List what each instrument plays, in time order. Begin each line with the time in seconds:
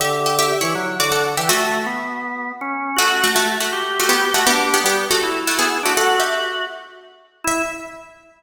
0.00 drawbar organ D3, harpsichord G4 E5
0.26 harpsichord G4 E5
0.39 harpsichord G4 E5
0.61 drawbar organ E3, harpsichord E4 C#5
0.75 drawbar organ F#3
1.00 drawbar organ D3, harpsichord F#4 D5
1.12 harpsichord A4 F#5
1.37 drawbar organ E3, harpsichord G4 E5
1.49 harpsichord A3 F#4, drawbar organ A3
1.86 drawbar organ B3
2.61 drawbar organ C#4
2.96 harpsichord A3 F#4, drawbar organ F#4
3.24 harpsichord A3 F#4
3.35 drawbar organ A3, harpsichord A3 F#4
3.60 harpsichord A3 F#4
3.73 drawbar organ G4
3.99 harpsichord A3 F#4
4.09 harpsichord B3 G4
4.34 harpsichord A3 F#4, drawbar organ F#4
4.47 harpsichord B3 G4, drawbar organ D4
4.74 harpsichord B3 G4
4.84 drawbar organ G3, harpsichord B3 G4
5.11 harpsichord A3 F#4
5.23 drawbar organ E4
5.47 harpsichord A3 F#4
5.59 harpsichord B3 G#4
5.83 harpsichord A3 F#4, drawbar organ D4
5.97 drawbar organ F#4, harpsichord A4 F#5
6.19 drawbar organ F#4, harpsichord G4 E5
7.44 drawbar organ E4, harpsichord E5